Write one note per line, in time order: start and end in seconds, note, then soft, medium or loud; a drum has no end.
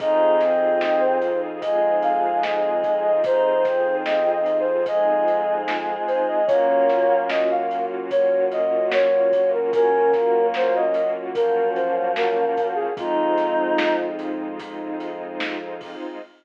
0.00 5.97 F2 loud
0.00 6.42 C4 medium
0.00 6.36 C4 medium
0.00 0.39 D#4 medium
0.00 6.42 D#4 medium
0.00 6.36 D#4 medium
0.00 6.42 F4 medium
0.00 6.36 F4 medium
0.00 6.42 G#4 medium
0.00 6.36 G#4 medium
0.00 0.79 D#5 loud
0.00 kick loud
0.00 closed hi-hat loud
0.40 1.18 C4 medium
0.40 snare medium
0.40 closed hi-hat medium
0.81 1.02 D#5 medium
0.81 snare loud
1.00 1.39 C5 medium
1.22 closed hi-hat medium
1.61 3.10 G#3 medium
1.61 1.96 D#5 medium
1.61 kick medium
1.61 closed hi-hat loud
2.02 2.42 F5 medium
2.02 closed hi-hat medium
2.43 2.99 D#5 medium
2.43 snare loud
2.83 kick loud
2.83 closed hi-hat medium
3.03 3.22 D#5 medium
3.24 3.62 D#4 medium
3.24 3.95 C5 loud
3.24 kick loud
3.24 closed hi-hat loud
3.65 4.37 C4 medium
3.65 kick loud
3.65 snare medium
3.65 closed hi-hat medium
4.05 4.31 D#5 medium
4.05 snare loud
4.32 4.57 D#5 medium
4.46 closed hi-hat medium
4.59 4.85 C5 medium
4.86 6.45 G#3 medium
4.86 5.55 D#5 medium
4.86 kick loud
4.86 closed hi-hat loud
5.28 closed hi-hat medium
5.68 snare loud
6.07 6.26 C5 medium
6.07 closed hi-hat medium
6.28 6.47 D#5 medium
6.47 12.45 F#2 medium
6.47 12.90 A#3 medium
6.47 12.84 A#3 medium
6.47 7.24 A#3 medium
6.47 12.90 C#4 medium
6.47 12.84 C#4 medium
6.47 12.90 F4 medium
6.47 12.84 F4 medium
6.47 12.90 F#4 medium
6.47 12.84 F#4 medium
6.47 7.17 C#5 medium
6.47 kick loud
6.47 closed hi-hat loud
6.89 snare medium
6.89 closed hi-hat medium
7.29 7.49 D#5 medium
7.29 snare loud
7.51 7.85 F5 medium
7.71 closed hi-hat medium
8.10 8.44 C#5 medium
8.10 kick loud
8.10 closed hi-hat loud
8.52 8.86 D#5 medium
8.52 closed hi-hat medium
8.92 9.50 C#5 medium
8.92 snare loud
9.32 kick loud
9.32 closed hi-hat medium
9.53 9.72 A#4 medium
9.73 10.11 C#4 medium
9.73 10.46 A#4 loud
9.73 kick loud
9.73 closed hi-hat loud
10.13 10.85 A#3 medium
10.13 kick medium
10.13 snare medium
10.13 closed hi-hat medium
10.54 10.75 C5 medium
10.54 snare loud
10.75 11.10 D#5 medium
10.94 closed hi-hat loud
11.35 12.87 F3 medium
11.35 11.69 A#4 loud
11.35 kick loud
11.35 closed hi-hat loud
11.75 12.10 C5 medium
11.75 closed hi-hat medium
12.16 12.67 A#4 medium
12.16 snare loud
12.57 kick loud
12.57 closed hi-hat loud
12.75 12.94 G#4 medium
12.97 15.96 F2 medium
12.97 16.16 G#3 medium
12.97 16.19 G#3 medium
12.97 16.16 C4 medium
12.97 16.19 C4 medium
12.97 13.96 D#4 medium
12.97 16.16 D#4 medium
12.97 16.19 D#4 medium
12.97 16.16 F4 medium
12.97 16.19 F4 medium
12.97 14.08 F4 loud
12.97 kick loud
12.97 closed hi-hat loud
13.38 snare medium
13.38 closed hi-hat medium
13.78 snare loud
14.19 closed hi-hat medium
14.59 kick medium
14.59 closed hi-hat loud
15.00 closed hi-hat medium
15.40 snare loud
15.81 kick medium
15.81 open hi-hat medium